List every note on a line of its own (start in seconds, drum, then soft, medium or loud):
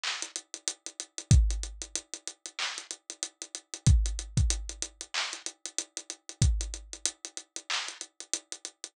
0.03 clap medium
0.22 closed hi-hat medium
0.36 closed hi-hat medium
0.54 closed hi-hat medium
0.68 closed hi-hat loud
0.86 closed hi-hat medium
1.00 closed hi-hat medium
1.18 closed hi-hat medium
1.31 kick loud
1.31 closed hi-hat medium
1.50 closed hi-hat medium
1.63 closed hi-hat medium
1.82 closed hi-hat medium
1.95 closed hi-hat medium
2.14 closed hi-hat medium
2.27 closed hi-hat medium
2.46 closed hi-hat medium
2.59 clap medium
2.78 closed hi-hat medium
2.91 closed hi-hat medium
3.10 closed hi-hat medium
3.23 closed hi-hat medium
3.42 closed hi-hat medium
3.55 closed hi-hat medium
3.74 closed hi-hat medium
3.86 kick loud
3.86 closed hi-hat medium
4.06 closed hi-hat medium
4.19 closed hi-hat medium
4.37 kick medium
4.37 closed hi-hat medium
4.50 closed hi-hat loud
4.69 closed hi-hat medium
4.82 closed hi-hat medium
5.01 closed hi-hat medium
5.14 clap loud
5.33 closed hi-hat medium
5.46 closed hi-hat medium
5.65 closed hi-hat medium
5.78 closed hi-hat medium
5.97 closed hi-hat medium
6.10 closed hi-hat medium
6.29 closed hi-hat medium
6.41 kick medium
6.41 closed hi-hat medium
6.61 closed hi-hat medium
6.74 closed hi-hat medium
6.93 closed hi-hat medium
7.05 closed hi-hat loud
7.25 closed hi-hat medium
7.37 closed hi-hat medium
7.56 closed hi-hat medium
7.70 clap loud
7.88 closed hi-hat medium
8.01 closed hi-hat medium
8.20 closed hi-hat medium
8.33 closed hi-hat loud
8.52 closed hi-hat medium
8.65 closed hi-hat medium
8.84 closed hi-hat medium